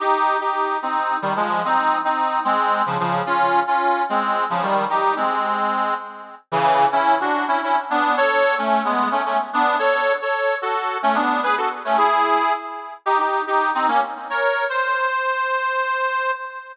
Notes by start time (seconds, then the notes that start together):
0.00 D#4 G4
0.41 D#4 G4
0.82 C4 D#4
1.22 D#3 G3
1.36 F3 G#3
1.65 C4 D#4
2.04 C4 D#4
2.45 G#3 C4
2.86 C#3 F3
3.00 C#3 F3
3.26 C#4 F4
3.67 C#4 F4
4.09 G#3 C4
4.50 C#3 F3
4.62 D#3 G3
4.90 D#4 G4
5.16 G#3 C4
6.52 C#3 E3
6.92 C#4 E4
7.21 D4 F#4
7.48 C#4 E4
7.63 C#4 E4
7.90 B3 D4
8.17 A4 C#5
8.58 A3 C#4
8.85 G#3 B3
9.12 A3 C#4
9.26 A3 C#4
9.53 B3 D4
9.79 A4 C#5
10.22 A4 C#5
10.62 F#4 A4
11.03 A3 C#4
11.15 B3 D4
11.43 G#4 B4
11.57 F#4 A4
11.85 A3 C#4
11.97 E4 G#4
13.06 D#4 G4
13.19 D#4 G4
13.47 D#4 G4
13.75 C4 D#4
13.88 A#3 C#4
14.30 A#4 C#5
14.70 C5